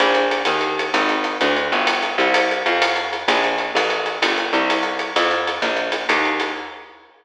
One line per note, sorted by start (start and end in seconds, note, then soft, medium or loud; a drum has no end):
0.00 0.43 A#1 medium
0.00 closed hi-hat medium
0.14 closed hi-hat medium
0.31 closed hi-hat medium
0.45 0.90 D#2 medium
0.45 closed hi-hat loud
0.61 closed hi-hat medium
0.79 closed hi-hat medium
0.94 1.37 G#1 medium
0.94 closed hi-hat medium
1.09 closed hi-hat medium
1.24 closed hi-hat medium
1.41 1.71 D2 medium
1.41 closed hi-hat medium
1.56 closed hi-hat medium
1.72 2.17 G1 medium
1.72 closed hi-hat medium
1.87 closed hi-hat loud
2.02 closed hi-hat medium
2.18 2.63 C2 medium
2.18 closed hi-hat medium
2.34 closed hi-hat loud
2.51 closed hi-hat medium
2.66 3.25 F2 medium
2.66 closed hi-hat medium
2.82 closed hi-hat loud
2.96 closed hi-hat medium
3.13 closed hi-hat medium
3.28 3.71 A#1 medium
3.28 closed hi-hat loud
3.44 closed hi-hat medium
3.58 closed hi-hat medium
3.75 4.18 A1 medium
3.75 closed hi-hat loud
3.90 closed hi-hat medium
4.06 closed hi-hat medium
4.22 4.52 G1 medium
4.22 closed hi-hat loud
4.38 closed hi-hat medium
4.53 5.12 C2 medium
4.53 closed hi-hat medium
4.70 closed hi-hat medium
4.83 closed hi-hat medium
4.99 closed hi-hat medium
5.16 5.59 F2 medium
5.16 closed hi-hat loud
5.31 closed hi-hat medium
5.47 closed hi-hat medium
5.62 6.05 A#1 medium
5.62 closed hi-hat medium
5.77 closed hi-hat medium
5.92 closed hi-hat medium
6.09 6.52 D#2 medium
6.09 closed hi-hat loud
6.25 closed hi-hat medium
6.40 closed hi-hat medium